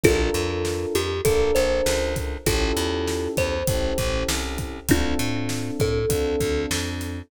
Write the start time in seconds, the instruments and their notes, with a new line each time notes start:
0.04 electric bass (finger) A#1, electric piano 1 D4 F4 A4 A#4, kalimba F4 A4, kick, closed hi-hat
0.34 electric bass (finger) F2, closed hi-hat
0.65 snare
0.95 electric bass (finger) F2, kalimba G4, closed hi-hat
1.25 electric bass (finger) A#1, electric piano 1 D4 F4 A4 A#4, kalimba A4, kick, closed hi-hat
1.55 electric bass (finger) A#1, kalimba C5, snare, closed hi-hat
1.86 electric bass (finger) C#2, snare
2.16 kick, snare, closed hi-hat
2.46 electric bass (finger) A1, electric piano 1 C#4 E4 G4 A4, kalimba F4 A4, kick, closed hi-hat
2.77 electric bass (finger) E2, closed hi-hat
3.07 snare
3.37 electric bass (finger) E2, kalimba C5, kick, closed hi-hat
3.67 electric bass (finger) A1, electric piano 1 C#4 E4 G4 A4, kick, closed hi-hat
3.98 electric bass (finger) A1, kick, closed hi-hat
4.28 electric bass (finger) C2, snare
4.58 kick, snare, closed hi-hat
4.89 electric bass (finger) D2, electric piano 1 C4 D4 F4 A4, kalimba D4 F4, kick, closed hi-hat
5.19 electric bass (finger) A2, closed hi-hat
5.49 snare
5.80 electric bass (finger) A2, kalimba A4, kick, closed hi-hat
6.09 electric bass (finger) D2, electric piano 1 C4 D4 F4 A4, kick, closed hi-hat
6.40 electric bass (finger) D2, kick, closed hi-hat
6.71 electric bass (finger) F2, snare
7.01 snare, closed hi-hat